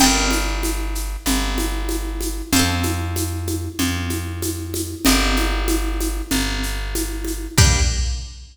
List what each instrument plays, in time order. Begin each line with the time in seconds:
0.00 electric bass (finger) G1, orchestral harp D5 G5, crash, low conga, shaker
0.06 orchestral harp A#4
0.31 high conga, shaker
0.63 high conga, shaker
0.95 shaker
1.26 electric bass (finger) G1, low conga, shaker
1.58 high conga, shaker
1.89 high conga, shaker
2.21 high conga, shaker
2.53 electric bass (finger) F2, orchestral harp C5 F5, low conga, shaker
2.59 orchestral harp A4
2.83 high conga, shaker
3.16 high conga, shaker
3.47 high conga, shaker
3.79 electric bass (finger) F2, low conga, shaker
4.10 high conga, shaker
4.42 high conga, shaker
4.74 high conga, shaker
5.05 electric bass (finger) G1, orchestral harp D#5, low conga, shaker
5.09 orchestral harp G4 A#4
5.36 high conga, shaker
5.68 high conga, shaker
6.00 high conga, shaker
6.31 electric bass (finger) G1, low conga, shaker
6.63 shaker
6.95 high conga, shaker
7.25 high conga, shaker
7.58 electric bass (finger) G2, orchestral harp D4 G4, kick, crash
7.64 orchestral harp A#3